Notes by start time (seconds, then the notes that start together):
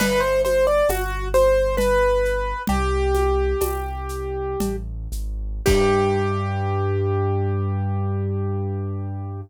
0.00 G1 B4, crash, cowbell, low conga, shaker
0.20 C5
0.45 C5, high conga, shaker
0.67 D5
0.88 G1 F#4, tambourine, cowbell, high conga, shaker
1.34 C5, high conga, shaker
1.77 B4, cowbell, low conga, shaker
2.25 shaker
2.67 C2 G4, cowbell, low conga, shaker
3.15 high conga, shaker
3.61 C2, tambourine, cowbell, high conga, shaker
4.09 shaker
4.60 A1, cowbell, low conga, shaker
5.12 G#1, shaker
5.66 G2 G4, kick, crash